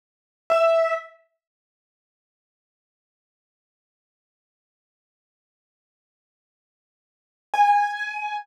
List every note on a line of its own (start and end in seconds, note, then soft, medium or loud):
0.50 0.93 E5 medium
7.54 8.41 G#5 medium